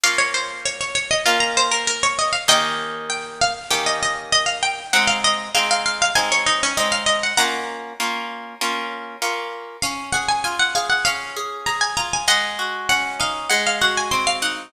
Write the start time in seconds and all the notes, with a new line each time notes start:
0.03 A#3 C#4 F4 F5
0.18 C#5
0.34 C5
0.65 C#5
0.81 C#5
0.95 C#5
1.11 D#5
1.26 A#3 C#4 F4
1.40 A#5
1.57 C5
1.71 A#4
1.87 A#4
2.03 C#5
2.19 D#5
2.33 F5
2.48 D#3 A#3 C#4 G4 D#5 G5
3.10 G5
3.41 F5
3.70 D#3 A#3 C#4 G4 G5
3.86 D#5
4.03 D#5
4.32 D#5
4.46 F5
4.63 G5
4.93 G#3 C4 D#4 F#5
5.07 F5
5.24 D#5
5.55 G#3 C4 D#4 F5
5.71 F5
5.86 F5
6.02 F5
6.15 G#3 C4 D#4 G#5
6.32 C#5
6.46 D#4
6.63 C#4
6.77 G#3 C4 D#4 D#5
6.92 F5
7.06 D#5
7.23 F#5
7.37 A#3 C#4 F4 F#5 A#5
8.00 A#3 C#4 F4
8.61 A#3 C#4 F4
9.22 A#3 C#4 F4
9.82 C#4 F5
10.12 G#4 F#5
10.28 G#5
10.44 F4 G#5
10.59 F#5
10.75 G#4 F5
10.90 F#5
11.05 C#4 F5
11.36 G#4
11.66 G#4 A#5
11.81 G#5
11.97 F4 A#5
12.13 G#5
12.28 G#3 D#5 F#5
12.59 F#4
12.89 C#4 F#5
13.20 D#4 F5
13.49 G#3 F#5
13.67 F5
13.81 F#4 F#5
13.97 G#5
14.11 C4 C6
14.27 F5
14.42 D#4 F#5